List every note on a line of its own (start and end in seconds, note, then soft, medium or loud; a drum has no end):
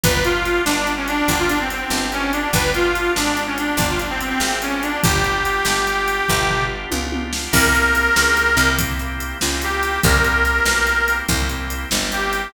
0.04 0.60 G1 loud
0.04 0.42 B3 medium
0.04 0.42 D4 medium
0.04 0.42 F4 medium
0.04 0.42 G4 medium
0.04 0.23 B4 medium
0.04 kick medium
0.04 closed hi-hat medium
0.24 0.62 F4 medium
0.24 closed hi-hat medium
0.45 0.65 B3 medium
0.45 0.65 D4 medium
0.45 0.65 F4 medium
0.45 0.65 G4 medium
0.45 closed hi-hat medium
0.65 1.22 G1 medium
0.65 0.85 B3 medium
0.65 0.92 D4 medium
0.65 0.85 D4 medium
0.65 0.85 F4 medium
0.65 0.85 G4 medium
0.65 snare medium
0.87 1.25 B3 medium
0.87 1.25 D4 medium
0.87 1.25 F4 medium
0.87 1.25 G4 medium
0.87 closed hi-hat medium
0.97 1.07 C#4 medium
1.08 1.38 D4 medium
1.08 closed hi-hat medium
1.28 1.84 G1 medium
1.28 1.48 B3 medium
1.28 1.48 D4 medium
1.28 1.48 F4 medium
1.28 1.48 G4 medium
1.28 kick medium
1.28 closed hi-hat medium
1.39 1.49 F4 medium
1.49 2.07 B3 medium
1.49 1.59 D4 medium
1.49 2.07 D4 medium
1.49 2.07 F4 medium
1.49 2.07 G4 medium
1.49 closed hi-hat medium
1.60 1.70 C4 medium
1.70 1.80 C4 medium
1.70 closed hi-hat medium
1.81 2.11 C4 medium
1.90 2.47 G1 medium
1.90 snare medium
2.12 2.31 B3 medium
2.12 2.32 C#4 medium
2.12 2.31 D4 medium
2.12 2.31 F4 medium
2.12 2.31 G4 medium
2.12 closed hi-hat medium
2.33 2.52 B3 medium
2.33 2.51 D4 medium
2.33 2.52 D4 medium
2.33 2.52 F4 medium
2.33 2.52 G4 medium
2.33 closed hi-hat medium
2.53 3.09 G1 loud
2.53 2.92 B3 medium
2.53 2.92 D4 medium
2.53 2.92 F4 medium
2.53 2.92 G4 medium
2.53 2.71 B4 medium
2.53 kick medium
2.53 closed hi-hat medium
2.74 3.12 F4 medium
2.74 closed hi-hat medium
2.95 3.14 B3 medium
2.95 3.14 D4 medium
2.95 3.14 F4 medium
2.95 3.14 G4 medium
2.95 closed hi-hat medium
3.15 3.73 G#1 medium
3.15 3.35 B3 medium
3.15 3.43 D4 medium
3.15 3.35 D4 medium
3.15 3.35 F4 medium
3.15 3.35 G4 medium
3.15 snare medium
3.37 3.75 B3 medium
3.37 3.75 D4 medium
3.37 3.75 F4 medium
3.37 3.75 G4 medium
3.37 closed hi-hat medium
3.47 3.57 C#4 medium
3.58 3.88 D4 medium
3.58 closed hi-hat medium
3.77 4.33 G1 medium
3.77 3.98 B3 medium
3.77 3.98 D4 medium
3.77 3.98 F4 medium
3.77 3.98 G4 medium
3.77 kick medium
3.77 closed hi-hat medium
3.90 4.00 F4 medium
3.99 4.57 B3 medium
3.99 4.09 D4 medium
3.99 4.57 D4 medium
3.99 4.57 F4 medium
3.99 4.57 G4 medium
3.99 closed hi-hat medium
4.10 4.20 C4 medium
4.20 4.29 C4 medium
4.20 closed hi-hat medium
4.29 4.59 C4 medium
4.40 4.96 G#1 medium
4.40 snare medium
4.62 4.81 B3 medium
4.62 4.83 C#4 medium
4.62 4.81 D4 medium
4.62 4.81 F4 medium
4.62 4.81 G4 medium
4.62 closed hi-hat medium
4.83 5.02 B3 medium
4.83 5.02 D4 medium
4.83 5.01 D4 medium
4.83 5.02 F4 medium
4.83 5.02 G4 medium
4.83 closed hi-hat medium
5.03 5.60 G1 loud
5.03 5.42 B3 medium
5.03 5.42 D4 medium
5.03 5.42 F4 medium
5.03 6.64 G4 medium
5.03 5.42 G4 medium
5.03 kick loud
5.03 closed hi-hat medium
5.24 closed hi-hat medium
5.45 5.64 B3 medium
5.45 5.64 D4 medium
5.45 5.64 F4 medium
5.45 5.64 G4 medium
5.45 closed hi-hat medium
5.65 6.21 G1 medium
5.65 5.85 B3 medium
5.65 5.85 D4 medium
5.65 5.85 F4 medium
5.65 5.85 G4 medium
5.65 snare medium
5.87 6.25 B3 medium
5.87 6.25 D4 medium
5.87 6.25 F4 medium
5.87 6.25 G4 medium
5.87 closed hi-hat medium
6.08 closed hi-hat medium
6.28 6.86 G1 loud
6.28 6.48 B3 medium
6.28 6.48 D4 medium
6.28 6.48 F4 medium
6.28 6.48 G4 medium
6.28 kick medium
6.28 floor tom medium
6.49 7.07 B3 medium
6.49 7.07 D4 medium
6.49 7.07 F4 medium
6.49 7.07 G4 medium
6.49 floor tom medium
6.91 7.48 C#2 medium
6.91 high tom medium
7.12 7.31 B3 medium
7.12 7.31 D4 medium
7.12 7.31 F4 medium
7.12 7.31 G4 medium
7.12 high tom medium
7.33 7.52 B3 medium
7.33 7.52 D4 medium
7.33 7.52 F4 medium
7.33 7.52 G4 medium
7.33 snare medium
7.52 8.09 C2 loud
7.52 7.73 A#3 medium
7.52 7.73 C4 medium
7.52 7.73 E4 medium
7.52 7.73 G4 medium
7.52 8.70 A#4 medium
7.52 kick medium
7.52 crash medium
7.74 7.94 A#3 medium
7.74 7.94 C4 medium
7.74 7.94 E4 medium
7.74 7.94 G4 medium
7.74 closed hi-hat medium
7.95 8.53 A#3 medium
7.95 8.53 C4 medium
7.95 8.53 E4 medium
7.95 8.53 G4 medium
7.95 closed hi-hat medium
8.16 8.56 C#2 loud
8.16 snare medium
8.37 closed hi-hat medium
8.57 9.34 C2 loud
8.57 8.77 A#3 medium
8.57 8.77 C4 medium
8.57 8.77 E4 medium
8.57 8.77 G4 medium
8.57 closed hi-hat medium
8.79 8.98 A#3 medium
8.79 8.98 C4 medium
8.79 8.98 E4 medium
8.79 8.98 G4 medium
8.79 kick medium
8.79 closed hi-hat loud
8.99 9.38 A#3 medium
8.99 9.38 C4 medium
8.99 9.38 E4 medium
8.99 9.38 G4 medium
8.99 closed hi-hat medium
9.20 closed hi-hat medium
9.41 9.98 C#2 medium
9.41 9.60 A#3 medium
9.41 9.60 C4 medium
9.41 9.60 E4 medium
9.41 9.60 G4 medium
9.41 snare medium
9.62 10.00 A#3 medium
9.62 10.00 C4 medium
9.62 10.00 E4 medium
9.62 10.00 G4 medium
9.62 closed hi-hat medium
9.83 closed hi-hat medium
10.03 10.60 C2 loud
10.03 10.23 A#3 medium
10.03 10.23 C4 medium
10.03 10.23 E4 medium
10.03 10.23 G4 medium
10.03 11.16 A#4 medium
10.03 kick medium
10.03 closed hi-hat medium
10.24 10.44 A#3 medium
10.24 10.44 C4 medium
10.24 10.44 E4 medium
10.24 10.44 G4 medium
10.24 closed hi-hat medium
10.45 11.03 A#3 medium
10.45 11.03 C4 medium
10.45 11.03 E4 medium
10.45 11.03 G4 medium
10.45 closed hi-hat medium
10.65 11.22 B1 medium
10.65 snare medium
10.87 closed hi-hat medium
11.08 11.27 A#3 medium
11.08 11.27 C4 medium
11.08 11.27 E4 medium
11.08 11.27 G4 medium
11.08 closed hi-hat medium
11.29 11.85 C2 loud
11.29 11.48 A#3 medium
11.29 11.48 C4 medium
11.29 11.48 E4 medium
11.29 11.48 G4 medium
11.29 kick medium
11.29 closed hi-hat medium
11.49 11.88 A#3 medium
11.49 11.88 C4 medium
11.49 11.88 E4 medium
11.49 11.88 G4 medium
11.49 closed hi-hat medium
11.70 closed hi-hat medium
11.91 12.48 G1 loud
11.91 12.10 A#3 medium
11.91 12.10 C4 medium
11.91 12.10 E4 medium
11.91 12.10 G4 medium
11.91 snare medium
12.12 12.50 A#3 medium
12.12 12.50 C4 medium
12.12 12.50 E4 medium
12.12 12.50 G4 medium
12.12 12.52 G4 medium
12.12 closed hi-hat medium
12.33 closed hi-hat medium